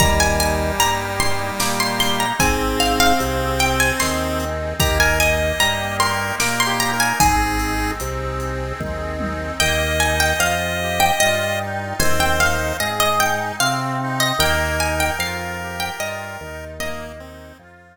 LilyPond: <<
  \new Staff \with { instrumentName = "Harpsichord" } { \time 3/4 \key ees \major \tempo 4 = 75 bes''16 aes''16 aes''8 bes''8 c'''8 d'''16 c'''16 c'''16 bes''16 | aes''8 f''16 f''16 r8 g''16 aes''16 c'''4 | bes''16 aes''16 aes''8 bes''8 c'''8 d'''16 c'''16 bes''16 aes''16 | aes''2 r4 |
g''8 aes''16 g''16 f''8 r16 g''16 ees''4 | aes''16 g''16 f''8 ees''16 ees''16 g''8 f''8. ees''16 | g''8 aes''16 g''16 f''8 r16 g''16 ees''4 | ees''2 r4 | }
  \new Staff \with { instrumentName = "Lead 1 (square)" } { \time 3/4 \key ees \major g2. | c'2. | g'16 bes'16 ees''4 bes'8 \tuplet 3/2 { bes'8 g'8 bes'8 } | aes'4 r2 |
ees''2. | c''4 r2 | bes'2. | bes8 c'8 r2 | }
  \new Staff \with { instrumentName = "Accordion" } { \time 3/4 \key ees \major bes8 ees'8 g'8 ees'8 bes8 ees'8 | c'8 ees'8 aes'8 ees'8 c'8 ees'8 | bes8 ees'8 g'8 ees'8 bes8 ees'8 | c'8 ees'8 aes'8 ees'8 c'8 ees'8 |
bes8 ees'8 f'8 g'8 f'8 ees'8 | c'8 ees'8 aes'8 ees'8 c'8 ees'8 | bes8 ees'8 f'8 g'8 f'8 ees'8 | bes8 ees'8 f'8 r4. | }
  \new Staff \with { instrumentName = "Drawbar Organ" } { \clef bass \time 3/4 \key ees \major ees,4 g,4 bes,4 | aes,,4 c,4 ees,4 | ees,4 g,4 bes,4 | aes,,4 c,4 ees,4 |
ees,4 f,4 g,4 | ees,4 aes,4 c4 | ees,4 f,4 g,8 ees,8~ | ees,4 f,4 r4 | }
  \new DrumStaff \with { instrumentName = "Drums" } \drummode { \time 3/4 <hh bd>8 hh8 hh8 hh8 sn8 hho8 | <hh bd>8 hh8 hh8 hh8 sn8 hh8 | <hh bd>8 hh8 hh8 hh8 sn8 hh8 | <hh bd>8 hh8 hh8 hh8 <bd tommh>8 tommh8 |
r4 r4 r4 | r4 r4 r4 | r4 r4 r4 | r4 r4 r4 | }
>>